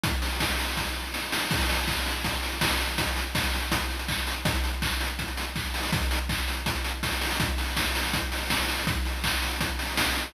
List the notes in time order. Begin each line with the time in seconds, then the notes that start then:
0.04 kick, closed hi-hat
0.22 open hi-hat
0.40 kick, snare
0.59 open hi-hat
0.77 kick, snare
1.14 snare
1.32 snare
1.51 kick, crash
1.60 closed hi-hat
1.69 open hi-hat
1.78 closed hi-hat
1.88 kick, clap
1.97 closed hi-hat
2.06 open hi-hat
2.15 closed hi-hat
2.24 kick, closed hi-hat
2.34 closed hi-hat
2.43 open hi-hat
2.52 closed hi-hat
2.61 kick, snare
2.70 closed hi-hat
2.80 open hi-hat
2.89 closed hi-hat
2.98 kick, closed hi-hat
3.07 closed hi-hat
3.16 open hi-hat
3.26 closed hi-hat
3.35 kick, snare
3.44 closed hi-hat
3.53 open hi-hat
3.62 closed hi-hat
3.72 kick, closed hi-hat
3.81 closed hi-hat
3.90 open hi-hat
3.99 closed hi-hat
4.08 kick, clap
4.18 closed hi-hat
4.27 open hi-hat
4.36 closed hi-hat
4.45 kick, closed hi-hat
4.54 closed hi-hat
4.64 open hi-hat
4.73 closed hi-hat
4.82 kick, clap
4.91 closed hi-hat
5.00 open hi-hat
5.10 closed hi-hat
5.19 kick, closed hi-hat
5.28 closed hi-hat
5.37 open hi-hat
5.46 closed hi-hat
5.56 kick, clap
5.65 closed hi-hat
5.74 open hi-hat
5.83 open hi-hat
5.92 kick, closed hi-hat
6.02 closed hi-hat
6.11 open hi-hat
6.20 closed hi-hat
6.29 kick, clap
6.38 closed hi-hat
6.48 open hi-hat
6.57 closed hi-hat
6.66 kick, closed hi-hat
6.75 closed hi-hat
6.85 open hi-hat
6.94 closed hi-hat
7.03 kick, snare
7.12 closed hi-hat
7.21 open hi-hat
7.31 open hi-hat
7.40 kick, closed hi-hat
7.58 open hi-hat
7.77 kick, snare
7.95 open hi-hat
8.13 kick, closed hi-hat
8.32 open hi-hat
8.50 kick, snare
8.69 open hi-hat
8.87 kick, closed hi-hat
9.05 open hi-hat
9.24 kick, clap
9.42 open hi-hat
9.61 kick, closed hi-hat
9.79 open hi-hat
9.97 kick, snare
10.16 open hi-hat